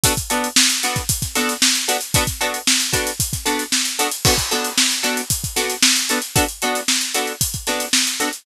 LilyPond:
<<
  \new Staff \with { instrumentName = "Acoustic Guitar (steel)" } { \time 4/4 \key b \minor \tempo 4 = 114 <b d' fis' a'>8 <b d' fis' a'>4 <b d' fis' a'>4 <b d' fis' a'>4 <b d' fis' a'>8 | <b d' fis' a'>8 <b d' fis' a'>4 <b d' fis' a'>4 <b d' fis' a'>4 <b d' fis' a'>8 | <b d' fis' a'>8 <b d' fis' a'>4 <b d' fis' a'>4 <b d' fis' a'>4 <b d' fis' a'>8 | <b d' fis' a'>8 <b d' fis' a'>4 <b d' fis' a'>4 <b d' fis' a'>4 <b d' fis' a'>8 | }
  \new DrumStaff \with { instrumentName = "Drums" } \drummode { \time 4/4 <hh bd>16 <hh bd>16 hh16 hh16 sn16 <hh sn>16 hh16 <hh bd>16 <hh bd>16 <hh bd sn>16 <hh sn>16 <hh sn>16 sn16 hh16 hh16 hh16 | <hh bd>16 <hh bd sn>16 hh16 hh16 sn16 hh16 <hh bd>16 hh16 <hh bd>16 <hh bd sn>16 <hh sn>16 hh16 sn16 hh16 hh16 hh16 | <cymc bd>16 <hh bd>16 hh16 hh16 sn16 hh16 hh16 hh16 <hh bd>16 <hh bd>16 <hh sn>16 hh16 sn16 hh16 hh16 hh16 | <hh bd>16 hh16 hh16 <hh sn>16 sn16 hh16 hh16 hh16 <hh bd>16 <hh bd>16 <hh sn>16 hh16 sn16 hh16 hh16 hh16 | }
>>